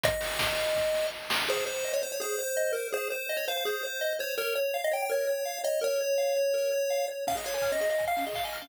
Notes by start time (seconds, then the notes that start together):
0.03 D#5, kick, closed hi-hat
0.21 open hi-hat
0.39 kick, snare
0.58 open hi-hat
0.75 kick, snare
0.94 snare
1.30 snare
1.48 G#4 C5
1.66 C5
1.84 D#5
1.93 C#5
2.02 C5
2.12 C#5
2.20 G#4 C5
2.39 C5
2.57 D#5
2.73 A#4 C5
2.92 G#4 C5
3.10 C5
3.29 D#5
3.37 C#5
3.48 C5 F5
3.57 F5
3.65 G#4 C5
3.83 C5
4.01 D#5
4.19 C5 C#5
4.38 A#4 C#5
4.55 C#5
4.74 F5
4.84 D#5
4.91 C#5 G5
5.02 G5
5.09 A#4 C#5
5.27 C#5
5.45 F5
5.64 C#5 D#5
5.81 A#4 C#5
6.01 C#5
6.18 F5
6.37 C#5
6.54 A#4
6.72 C#5
6.90 F5
7.08 C#5
7.27 C#4 F5, kick, crash
7.35 G#4 D#5
7.44 C#5 F5, open hi-hat
7.54 C#5 G#5
7.62 F6, kick, clap
7.72 C#4 D#5
7.80 G#4 D#5, open hi-hat
7.90 D#5 F5
7.98 G#5, kick, closed hi-hat
8.08 F5 F6
8.17 C#4 F5, open hi-hat
8.26 G#4 D#5
8.33 F5, kick, clap
8.44 D#5 G#5
8.53 F6, open hi-hat
8.62 C#4 F5